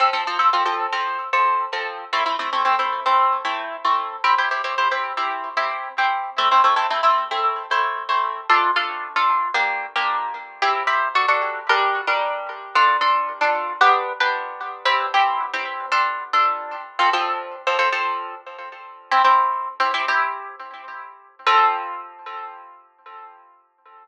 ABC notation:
X:1
M:4/4
L:1/16
Q:1/4=113
K:F
V:1 name="Orchestral Harp"
[F,CA] [F,CA] [F,CA] [F,CA] [F,CA] [F,CA]2 [F,CA]3 [F,CA]3 [F,CA]3 | [A,CE] [A,CE] [A,CE] [A,CE] [A,CE] [A,CE]2 [A,CE]3 [A,CE]3 [A,CE]3 | [CEG] [CEG] [CEG] [CEG] [CEG] [CEG]2 [CEG]3 [CEG]3 [CEG]3 | [A,CE] [A,CE] [A,CE] [A,CE] [A,CE] [A,CE]2 [A,CE]3 [A,CE]3 [A,CE]3 |
[K:Dm] [DFA]2 [DFA]3 [DFA]3 [B,DG]3 [B,DG]5 | [CEG]2 [CEG]2 [D^FA] [DFA]3 [G,DB]3 [G,DB]5 | [DFA]2 [DFA]3 [DFA]3 [=B,DG]3 [B,DG]5 | [CEG]2 [CEG]3 [CEG]3 [DFA]3 [DFA]5 |
[K:F] [F,CA] [F,CA]4 [F,CA] [F,CA] [F,CA]9 | "^rit." [CEG] [CEG]4 [CEG] [CEG] [CEG]9 | [F,CA]16 |]